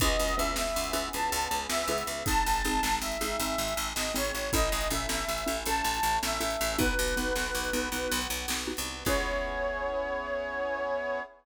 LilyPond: <<
  \new Staff \with { instrumentName = "Flute" } { \time 12/8 \key cis \minor \tempo 4. = 106 dis''4 e''8 e''4. a''4. e''4. | a''2 e''2~ e''8 dis''8 cis''4 | dis''4 e''8 e''4. a''4. e''4. | b'1 r2 |
cis''1. | }
  \new Staff \with { instrumentName = "Xylophone" } { \time 12/8 \key cis \minor <cis' e' gis' b'>4 <cis' e' gis' b'>4. <cis' e' gis' b'>8 <cis' e' gis' b'>2 <cis' e' gis' b'>4 | <bis dis' gis'>4 <bis dis' gis'>4. <bis dis' gis'>8 <bis dis' gis'>2 <bis dis' gis'>4 | <cis' e' a'>4 <cis' e' a'>4. <cis' e' a'>8 <cis' e' a'>2 <cis' e' a'>4 | <b dis' fis'>4 <b dis' fis'>4. <b dis' fis'>8 <b dis' fis'>2 <b dis' fis'>4 |
<cis' e' gis' b'>1. | }
  \new Staff \with { instrumentName = "Electric Bass (finger)" } { \clef bass \time 12/8 \key cis \minor cis,8 cis,8 cis,8 cis,8 cis,8 cis,8 cis,8 cis,8 cis,8 cis,8 cis,8 cis,8 | gis,,8 gis,,8 gis,,8 gis,,8 gis,,8 gis,,8 gis,,8 gis,,8 gis,,8 gis,,8 gis,,8 gis,,8 | a,,8 a,,8 a,,8 a,,8 a,,8 a,,8 a,,8 a,,8 a,,8 a,,8 a,,8 a,,8 | b,,8 b,,8 b,,8 b,,8 b,,8 b,,8 b,,8 b,,8 b,,8 b,,8. bis,,8. |
cis,1. | }
  \new Staff \with { instrumentName = "Brass Section" } { \time 12/8 \key cis \minor <b cis' e' gis'>2. <b cis' gis' b'>2. | <bis dis' gis'>2. <gis bis gis'>2. | <cis' e' a'>2. <a cis' a'>2. | <b dis' fis'>2. <b fis' b'>2. |
<b cis' e' gis'>1. | }
  \new DrumStaff \with { instrumentName = "Drums" } \drummode { \time 12/8 <hh bd>8. hh8. sn8. hh8. hh8. hh8. sn8. hh8. | <hh bd>8. hh8. sn8. hh8. hh8. hh8. sn8. hh8. | <hh bd>8. hh8. sn8. hh8. hh8. hh8. sn8. hh8. | <hh bd>8. hh8. sn8. hh8. hh8. hh8. sn8. hh8. |
<cymc bd>4. r4. r4. r4. | }
>>